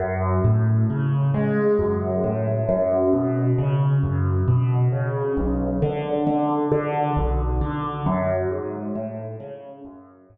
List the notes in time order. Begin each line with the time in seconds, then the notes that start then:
0.00 F#2
0.45 A2
0.90 C#3
1.34 G#3
1.79 F#2
2.24 A2
2.69 F#2
3.13 B2
3.58 C#3
4.03 F#2
4.48 B2
4.92 C#3
5.37 B1
5.82 D3
6.27 D3
6.72 D3
7.17 B1
7.61 D3
8.06 F#2
8.51 G#2
8.95 A2
9.40 C#3
9.85 F#2
10.30 G#2